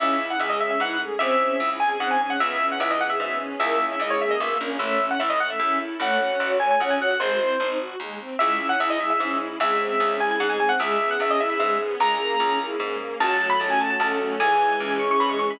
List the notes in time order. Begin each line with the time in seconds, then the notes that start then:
0.00 C#2 C#4 E4 G#4 E5
0.19 E4
0.30 F#5
0.40 C#2 G#3 G#4 E5
0.50 D#5
0.60 G#3 C#4 G#4 E5
0.71 E5
0.80 G#2 B3 E4 F#5
1.00 A3 G#4
1.19 C#2 C4 C#4 E4 G#4 E5
1.40 C#4
1.60 C#2 E4
1.79 G#3 C4 C#4 G#4 G#5
1.90 G#5
1.99 G#2 C4 F#5
2.11 G#5
2.20 C#4 G#5
2.30 F#5
2.39 C#2 B3 C#4 E4 G#4 E5
2.60 C#4
2.72 F#5
2.79 C#2 E3 E4 E5
2.91 D#5
3.00 B3 C#4 G#4 B4 F#5
3.10 E5
3.20 G#2 F#3 B3 E5
3.39 E3 C#4
3.60 C#2 A#3 C#4 E4 G#4 E5
3.80 C#4
3.92 E5
4.00 C#2 G#3 E4 D#5
4.10 C#5
4.21 A#3 C#4 G#4 A#4 E5
4.31 D#5
4.40 B1 A#3 B3 E5
4.60 A#1 A#3 C#4
4.79 A1 A3 C#4 E4 A4 E5
5.00 C#4
5.11 F#5
5.20 A1 E4 E5
5.30 D#5
5.40 A3 F#5
5.50 E5
5.60 E2 C#4 E4 E5
5.79 E4
6.00 A1 A3 C#4 F#4 A4 C#5 F#5
6.20 C#4
6.40 A1 F#4
6.60 A3 G#5
6.71 G#5
6.80 C#2 C#4 F#5
6.90 G#5
6.99 F#4 F#5
7.11 F#5
7.20 G#1 G#3 G#4 C5
7.30 F#4
7.40 C4 E4
7.60 G#1 C4 D#4
7.80 F#4
8.00 D#2 G#3
8.19 C4
8.39 C#2 G#3 C#4 E4 G#4 E5
8.60 C#4
8.69 F#5
8.80 C#2 E4 E5
8.90 D#5
8.99 G#3 C#4 G#4 E5
9.10 E5
9.20 G#2 C#4 E5
9.41 E4
9.60 C#2 G#3 C4 C#4 E4 G#4 E5
9.80 C4
10.00 C#2 C#4
10.19 G#3 C4 C#4 E4 G#4 G#5
10.31 G#5
10.40 G#2 G#3 F#5
10.50 G#5
10.60 C4 G#5
10.69 F#5
10.79 C#2 G#3 B3 C#4 E4 G#4 E5
11.00 B3
11.11 F#5
11.20 C#2 C#4 E5
11.31 D#5
11.40 B3 C#4 E4 G#4 B4 E5
11.50 E5
11.60 G#2 G#3 E5
11.81 B3
11.99 C#2 G#3 A#3 C#4 E4 G#4 A#5
12.20 A#3
12.40 C#2 C#4
12.60 A#3 C#4 E4 G#4 A#4
12.80 G#2 G#3
13.00 A#3
13.19 C#2 F#3 F#4 C#5 F#5 A5
13.40 A3
13.50 B5
13.60 C#2 C#4 A5
13.70 G#5
13.79 F#3 A5
13.90 A5
14.00 C#2 A3 A4 A5
14.19 C#4
14.40 C#2 E3 G#4 C#5 E5 G#5
14.60 G#3
14.80 C#2 C#4
14.99 E3 C#6
15.11 C#6
15.20 G#2 G#3 B5
15.29 C#6
15.39 C#4 C#6
15.51 B5